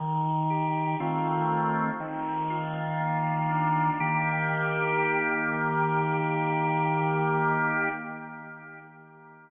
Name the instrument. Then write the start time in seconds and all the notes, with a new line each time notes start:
drawbar organ
0.00 D#3
0.50 G4
1.00 D#3 A3 C4 F4
2.00 D#3
2.50 F4
3.00 A#3
3.50 D4
4.00 D#3 A#3 G4